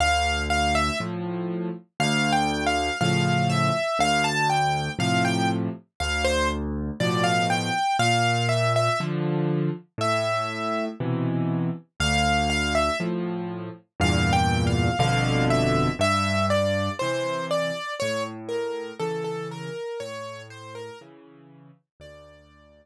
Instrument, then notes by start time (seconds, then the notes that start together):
acoustic grand piano
0.00 D2 F5
0.50 F5
0.75 E5
1.00 A2 F3
2.00 D2 F5
2.33 G5
2.66 F5
3.01 A2 C#3 F3 F5
3.50 E5
3.99 D2 F5
4.24 A5
4.50 G5
4.99 A2 C3 F3 F5
5.25 G5
6.00 D2 F5
6.25 C5
7.00 A2 B2 F3 D5
7.24 F5
7.50 G5
7.99 A#2 F5
8.49 E5
8.76 E5
9.00 D3 F3
9.98 A2 E5
11.00 B2 C3 E3
12.00 D2 F5
12.50 F5
12.75 E5
13.00 A2 F3
14.00 E2 G2 A#2 F5
14.33 G5
14.67 F5
14.99 G1 F2 B2 D3 F5
15.50 E5
15.99 G2 E5
16.50 D5
16.99 C3 E3 C5
17.51 D5
18.00 A2 C#5
18.49 A#4
19.00 C#3 E3 A4
19.24 A4
19.51 A#4
20.00 A2 C#5
20.50 C5
20.75 A#4
21.01 C#3 E3
22.00 D2 D5